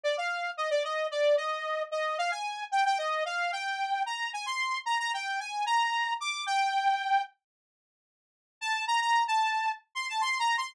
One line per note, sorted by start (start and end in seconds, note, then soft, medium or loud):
0.03 0.16 D5 medium
0.18 0.50 F5 medium
0.57 0.70 D#5 medium
0.70 0.83 D5 medium
0.84 1.07 D#5 medium
1.11 1.36 D5 medium
1.37 1.83 D#5 medium
1.91 2.17 D#5 medium
2.18 2.31 F5 medium
2.31 2.64 G#5 medium
2.72 2.84 G5 medium
2.85 2.98 G5 medium
2.98 3.24 D#5 medium
3.25 3.51 F5 medium
3.52 4.03 G5 medium
4.06 4.30 A#5 medium
4.33 4.46 G#5 medium
4.46 4.79 C6 medium
4.86 4.98 A#5 medium
4.99 5.12 A#5 medium
5.14 5.40 G5 medium
5.40 5.65 G#5 medium
5.66 6.14 A#5 medium
6.20 6.44 D6 medium
6.46 7.22 G5 medium
8.61 8.85 A5 medium
8.87 9.00 A#5 medium
9.01 9.24 A#5 medium
9.28 9.72 A5 medium
9.95 10.08 C6 medium
10.09 10.22 A5 medium
10.21 10.38 C6 medium
10.39 10.56 A#5 medium
10.58 10.74 C6 medium